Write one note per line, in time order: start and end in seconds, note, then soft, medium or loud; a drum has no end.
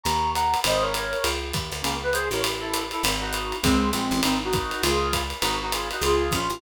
0.04 0.55 D#2 medium
0.04 0.30 A#5 medium
0.04 0.30 C#6 medium
0.04 ride medium
0.34 0.60 F#5 medium
0.34 0.60 A#5 medium
0.34 hi-hat pedal medium
0.34 ride medium
0.54 ride medium
0.64 1.15 G#1 medium
0.64 0.83 C5 medium
0.64 0.83 D#5 medium
0.64 ride loud
0.81 1.29 A#4 medium
0.81 1.29 C#5 medium
0.94 hi-hat pedal medium
0.94 ride medium
1.13 ride medium
1.24 1.53 C#2 medium
1.24 ride medium
1.53 1.70 D#2 medium
1.53 kick soft
1.53 hi-hat pedal medium
1.53 ride medium
1.72 1.82 D2 medium
1.72 ride medium
1.82 2.29 C#2 medium
1.82 1.97 A#3 medium
1.82 1.97 C#4 medium
1.82 ride medium
2.03 2.14 B4 medium
2.13 2.28 G#4 medium
2.13 2.28 C5 medium
2.13 hi-hat pedal medium
2.13 ride medium
2.31 2.93 A1 medium
2.31 2.41 A#4 medium
2.31 2.41 C#5 medium
2.31 ride medium
2.44 ride medium
2.60 2.83 E4 medium
2.60 2.83 A4 medium
2.74 hi-hat pedal medium
2.74 ride medium
2.91 3.03 E4 medium
2.91 3.03 A4 medium
2.91 ride medium
3.03 3.54 G#1 medium
3.03 ride loud
3.20 3.55 D#4 medium
3.20 3.55 F#4 medium
3.33 hi-hat pedal medium
3.33 ride medium
3.52 ride medium
3.62 3.92 C#2 medium
3.62 3.91 G#3 medium
3.62 3.91 C4 medium
3.62 kick medium
3.62 ride medium
3.91 4.10 A#1 medium
3.91 4.20 G#3 medium
3.91 4.20 C4 medium
3.91 hi-hat pedal medium
3.91 ride medium
4.11 4.22 A1 medium
4.11 ride medium
4.23 4.74 G#1 medium
4.23 4.39 C4 medium
4.23 4.39 D#4 medium
4.23 ride medium
4.44 4.82 D#4 medium
4.44 4.82 F#4 medium
4.53 kick medium
4.53 hi-hat pedal medium
4.53 ride medium
4.71 ride medium
4.82 5.33 C#2 loud
4.82 5.23 F4 medium
4.82 5.23 G#4 medium
4.82 ride medium
5.13 kick soft
5.13 hi-hat pedal medium
5.13 ride medium
5.30 ride medium
5.42 5.92 G#1 medium
5.42 5.56 D#4 medium
5.42 5.56 F#4 medium
5.42 ride medium
5.62 5.72 D#4 medium
5.62 5.72 F#4 medium
5.72 5.89 F4 medium
5.72 5.89 G#4 medium
5.72 hi-hat pedal medium
5.72 ride medium
5.91 6.02 D#4 medium
5.91 6.02 F#4 medium
5.91 ride medium
6.01 6.30 C#2 medium
6.01 6.32 F4 medium
6.01 6.33 G#4 medium
6.01 ride medium
6.31 6.49 A#1 medium
6.31 6.59 C#4 medium
6.31 6.59 F4 medium
6.31 kick soft
6.31 hi-hat pedal medium
6.31 ride medium
6.50 6.60 A1 medium
6.50 ride medium